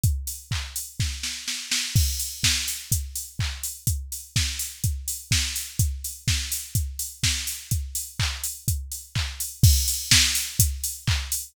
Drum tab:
CC |--------|x-------|--------|--------|
HH |xo-o----|-o-oxo-o|xo-oxo-o|xo-oxo-o|
CP |--x-----|------x-|--------|--------|
SD |----oooo|--o-----|--o---o-|--o---o-|
BD |o-o-o---|o-o-o-o-|o-o-o-o-|o-o-o-o-|

CC |--------|x-------|
HH |xo-oxo-o|-o-oxo-o|
CP |--x---x-|------x-|
SD |--------|--o-----|
BD |o-o-o-o-|o-o-o-o-|